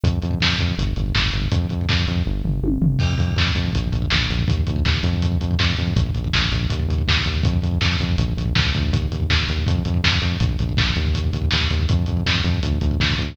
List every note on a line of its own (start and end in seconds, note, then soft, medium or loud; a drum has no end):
0.03 0.19 F2 medium
0.03 kick loud
0.03 closed hi-hat loud
0.13 kick medium
0.22 0.39 F2 medium
0.22 kick medium
0.22 closed hi-hat medium
0.31 kick medium
0.40 0.57 F2 medium
0.40 kick medium
0.40 snare loud
0.49 kick medium
0.58 0.75 F2 medium
0.58 kick loud
0.58 closed hi-hat medium
0.68 kick medium
0.78 0.94 G1 medium
0.78 kick medium
0.78 closed hi-hat loud
0.87 kick medium
0.96 1.12 G1 medium
0.96 kick medium
0.96 closed hi-hat medium
1.06 kick medium
1.15 1.31 G1 medium
1.15 kick loud
1.15 snare loud
1.24 kick medium
1.32 1.49 G1 medium
1.32 kick medium
1.32 closed hi-hat medium
1.42 kick medium
1.52 1.67 F2 medium
1.52 kick loud
1.52 closed hi-hat loud
1.62 kick medium
1.69 1.87 F2 medium
1.69 kick medium
1.69 closed hi-hat medium
1.81 kick medium
1.89 2.05 F2 medium
1.89 kick loud
1.89 snare loud
1.98 kick medium
2.07 2.23 F2 medium
2.07 kick medium
2.07 closed hi-hat medium
2.16 kick medium
2.26 2.43 G1 medium
2.26 kick medium
2.44 2.61 G1 medium
2.44 floor tom medium
2.62 2.78 G1 medium
2.62 high tom medium
2.81 2.97 G1 medium
2.81 floor tom loud
2.99 3.16 F2 medium
2.99 kick loud
2.99 crash loud
3.10 kick medium
3.18 3.35 F2 medium
3.18 kick loud
3.18 closed hi-hat medium
3.28 kick medium
3.36 3.52 F2 medium
3.36 kick loud
3.36 snare loud
3.47 kick loud
3.55 3.71 F2 medium
3.55 kick loud
3.55 closed hi-hat medium
3.65 kick medium
3.73 3.91 A#1 medium
3.73 kick loud
3.73 closed hi-hat loud
3.84 kick medium
3.92 4.09 A#1 medium
3.92 kick medium
3.92 closed hi-hat medium
4.02 kick loud
4.10 4.28 A#1 medium
4.10 kick loud
4.10 snare loud
4.21 kick medium
4.29 4.46 A#1 medium
4.29 kick medium
4.29 closed hi-hat medium
4.39 kick medium
4.48 4.64 D#2 medium
4.48 kick loud
4.48 closed hi-hat loud
4.57 kick medium
4.67 4.83 D2 medium
4.67 kick loud
4.67 closed hi-hat medium
4.76 kick medium
4.85 5.01 D#2 medium
4.85 kick loud
4.85 snare loud
4.94 kick loud
5.03 5.38 F2 loud
5.03 kick medium
5.03 closed hi-hat medium
5.13 kick medium
5.22 kick loud
5.22 closed hi-hat loud
5.32 kick medium
5.41 5.56 F2 medium
5.41 kick medium
5.41 closed hi-hat medium
5.51 kick medium
5.59 5.75 F2 loud
5.59 kick loud
5.59 snare loud
5.70 kick medium
5.77 5.94 F2 medium
5.77 kick medium
5.77 closed hi-hat medium
5.87 kick medium
5.96 6.12 A#1 loud
5.96 kick loud
5.96 closed hi-hat loud
6.06 kick loud
6.14 6.30 A#1 medium
6.14 kick medium
6.14 closed hi-hat medium
6.24 kick loud
6.33 6.50 A#1 medium
6.33 kick loud
6.33 snare loud
6.42 kick medium
6.52 6.67 A#1 medium
6.52 kick medium
6.52 closed hi-hat medium
6.61 kick medium
6.70 6.87 D#2 medium
6.70 kick loud
6.70 closed hi-hat loud
6.79 kick medium
6.88 7.04 D#2 medium
6.88 kick medium
6.88 closed hi-hat medium
6.98 kick medium
7.08 7.23 D#2 medium
7.08 kick loud
7.08 snare loud
7.17 kick medium
7.25 7.42 D#2 medium
7.25 kick medium
7.25 closed hi-hat medium
7.34 kick medium
7.43 7.60 F2 loud
7.43 kick loud
7.43 closed hi-hat loud
7.53 kick loud
7.62 7.79 F2 medium
7.62 kick medium
7.62 closed hi-hat medium
7.71 kick medium
7.81 7.97 F2 medium
7.81 kick loud
7.81 snare loud
7.92 kick medium
7.99 8.16 F2 medium
7.99 kick loud
7.99 closed hi-hat medium
8.09 kick medium
8.18 8.34 A#1 loud
8.18 kick loud
8.18 closed hi-hat loud
8.29 kick medium
8.37 8.53 A#1 medium
8.37 kick medium
8.37 closed hi-hat medium
8.46 kick medium
8.55 8.73 C#2 medium
8.55 kick loud
8.55 snare loud
8.64 kick loud
8.74 8.91 D2 medium
8.74 kick loud
8.74 closed hi-hat medium
8.83 kick medium
8.92 9.08 D#2 loud
8.92 kick loud
8.92 closed hi-hat loud
9.02 kick medium
9.11 9.27 D#2 medium
9.11 kick medium
9.11 closed hi-hat medium
9.20 kick medium
9.30 9.46 D#2 medium
9.30 kick loud
9.30 snare loud
9.40 kick medium
9.47 9.64 D#2 medium
9.47 kick medium
9.47 closed hi-hat medium
9.58 kick medium
9.67 9.83 F2 loud
9.67 kick loud
9.67 closed hi-hat loud
9.75 kick loud
9.85 10.02 F2 medium
9.85 kick medium
9.85 closed hi-hat medium
9.94 kick medium
10.04 10.20 F2 medium
10.04 kick medium
10.04 snare loud
10.12 kick loud
10.22 10.37 F2 medium
10.22 kick medium
10.22 closed hi-hat medium
10.32 kick medium
10.40 10.56 A#1 medium
10.40 kick loud
10.40 closed hi-hat loud
10.49 kick medium
10.59 10.75 A#1 medium
10.59 kick medium
10.59 closed hi-hat medium
10.69 kick medium
10.77 10.94 A#1 medium
10.77 kick loud
10.77 snare loud
10.87 kick medium
10.96 11.31 D#2 loud
10.96 kick medium
10.96 closed hi-hat medium
11.05 kick medium
11.15 kick medium
11.15 closed hi-hat loud
11.24 kick medium
11.33 11.49 D#2 medium
11.33 kick medium
11.33 closed hi-hat medium
11.42 kick medium
11.51 11.69 D#2 medium
11.51 kick medium
11.51 snare loud
11.61 kick medium
11.71 11.86 D#2 medium
11.71 kick medium
11.71 closed hi-hat medium
11.80 kick medium
11.89 12.06 F2 loud
11.89 kick loud
11.89 closed hi-hat loud
11.99 kick medium
12.06 12.23 F2 medium
12.06 kick medium
12.06 closed hi-hat medium
12.17 kick medium
12.26 12.42 F2 medium
12.26 kick loud
12.26 snare loud
12.35 kick medium
12.44 12.60 F2 loud
12.44 kick medium
12.44 closed hi-hat medium
12.53 kick medium
12.63 12.79 D2 medium
12.63 kick medium
12.63 closed hi-hat loud
12.72 kick medium
12.81 12.98 D2 loud
12.81 kick medium
12.81 closed hi-hat medium
12.91 kick medium
13.00 13.16 D2 medium
13.00 kick loud
13.00 snare loud
13.10 kick loud
13.18 13.35 D2 medium
13.18 kick medium
13.18 closed hi-hat medium
13.29 kick medium